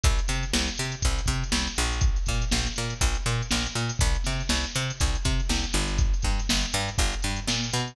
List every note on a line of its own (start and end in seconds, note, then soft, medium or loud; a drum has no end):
0.04 0.20 C2 medium
0.04 kick loud
0.04 closed hi-hat loud
0.19 closed hi-hat medium
0.28 0.45 C3 medium
0.28 snare medium
0.28 closed hi-hat medium
0.43 closed hi-hat medium
0.53 0.70 C2 medium
0.53 snare loud
0.68 closed hi-hat medium
0.77 0.95 C3 medium
0.77 closed hi-hat medium
0.92 closed hi-hat medium
1.02 1.21 C2 medium
1.02 kick loud
1.02 closed hi-hat loud
1.18 closed hi-hat medium
1.26 1.44 C3 medium
1.26 kick medium
1.26 closed hi-hat medium
1.43 closed hi-hat medium
1.52 1.68 C2 medium
1.52 snare loud
1.67 closed hi-hat medium
1.76 2.19 A#1 loud
1.76 closed hi-hat medium
1.93 closed hi-hat medium
2.01 kick loud
2.01 closed hi-hat loud
2.16 closed hi-hat medium
2.26 2.45 A#2 medium
2.26 kick medium
2.26 snare medium
2.26 closed hi-hat medium
2.42 closed hi-hat medium
2.51 2.68 A#1 medium
2.51 snare loud
2.66 snare soft
2.66 closed hi-hat medium
2.76 2.94 A#2 medium
2.76 snare soft
2.76 closed hi-hat medium
2.90 closed hi-hat medium
3.01 3.17 A#1 medium
3.01 kick loud
3.01 closed hi-hat loud
3.15 snare soft
3.15 closed hi-hat medium
3.26 3.42 A#2 medium
3.26 closed hi-hat medium
3.42 closed hi-hat medium
3.51 3.67 A#1 medium
3.51 snare loud
3.67 closed hi-hat medium
3.75 3.92 A#2 medium
3.75 closed hi-hat medium
3.89 closed hi-hat loud
3.99 4.17 C2 loud
3.99 kick loud
3.99 closed hi-hat loud
4.15 closed hi-hat medium
4.24 4.43 C3 medium
4.24 snare medium
4.24 closed hi-hat medium
4.39 snare soft
4.39 closed hi-hat medium
4.49 4.66 C2 medium
4.49 snare loud
4.64 closed hi-hat medium
4.75 4.92 C3 medium
4.75 closed hi-hat medium
4.90 closed hi-hat medium
5.00 5.17 C2 medium
5.00 kick loud
5.00 closed hi-hat loud
5.15 closed hi-hat medium
5.25 5.41 C3 medium
5.25 kick medium
5.25 closed hi-hat medium
5.40 closed hi-hat medium
5.49 5.65 C2 medium
5.49 snare loud
5.64 closed hi-hat medium
5.73 6.15 G1 medium
5.73 closed hi-hat medium
5.88 closed hi-hat medium
5.98 kick loud
5.98 closed hi-hat loud
6.14 closed hi-hat medium
6.22 6.40 G2 medium
6.22 kick medium
6.22 snare medium
6.22 closed hi-hat medium
6.38 snare soft
6.38 closed hi-hat medium
6.49 6.66 G1 medium
6.49 snare loud
6.62 closed hi-hat medium
6.73 6.90 G2 loud
6.73 closed hi-hat medium
6.88 closed hi-hat medium
6.98 7.15 G1 loud
6.98 kick loud
6.98 closed hi-hat loud
7.13 closed hi-hat medium
7.22 7.40 G2 medium
7.22 closed hi-hat medium
7.36 closed hi-hat medium
7.48 7.70 A#2 medium
7.48 snare loud
7.64 closed hi-hat medium
7.73 7.96 B2 medium
7.73 closed hi-hat loud
7.87 snare soft
7.87 closed hi-hat medium